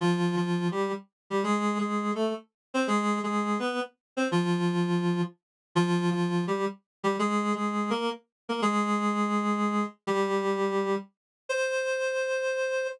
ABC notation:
X:1
M:4/4
L:1/8
Q:"Swing" 1/4=167
K:Cm
V:1 name="Clarinet"
[F,F]2 [F,F]2 [G,G] z2 [G,G] | [A,A]2 [A,A]2 [=A,=A] z2 [Cc] | [A,A]2 [A,A]2 [_C_c] z2 [=C=c] | [F,F]5 z3 |
[F,F]2 [F,F]2 [G,G] z2 [G,G] | [A,A]2 [A,A]2 [B,B] z2 [B,B] | [A,A]8 | [G,G]5 z3 |
c8 |]